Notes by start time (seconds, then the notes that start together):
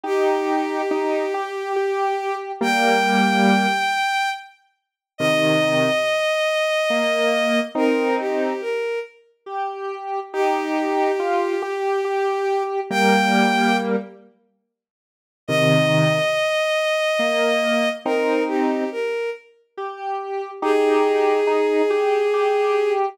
0.03 D#4 G4
0.91 D#4
1.34 G4
1.76 G4
2.61 G3 A#3 G5
5.18 C3 D#3 D#5
6.90 A#3
7.75 C4 D#4 A#4
8.20 G4
8.61 A#4
9.46 G4
10.33 D#4 G4
11.19 F4
11.62 G4
12.05 G4
12.90 G3 A#3 G5
15.48 C3 D#3 D#5
17.19 A#3
18.05 C4 D#4 A#4
18.48 G4
18.92 A#4
19.77 G4
20.62 D#4 G4 G#4
21.47 D#4
21.90 G4
22.33 G4